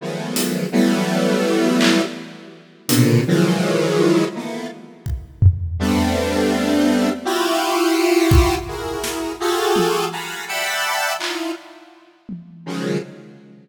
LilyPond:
<<
  \new Staff \with { instrumentName = "Lead 1 (square)" } { \time 6/4 \tempo 4 = 83 <dis f fis gis a b>4 <e fis g a b>2 r4 <ais, b, c d>8 <dis e f fis gis>4. | <a ais b>8 r4. <g a b c' d'>2 <e' f' fis' g'>2 | <e' fis' gis' ais'>4 <f' fis' g' gis' a'>4 <f'' fis'' gis'' a'' ais'' b''>8 <d'' e'' fis'' g'' a'' b''>4 <dis' e' f'>8 r4. <cis dis f fis gis>8 | }
  \new DrumStaff \with { instrumentName = "Drums" } \drummode { \time 6/4 r8 hh8 r4 r8 hc8 r4 hh4 r4 | r4 bd8 tomfh8 r4 r4 r4 r8 bd8 | r8 sn8 r8 tommh8 r4 r8 hc8 r4 tommh4 | }
>>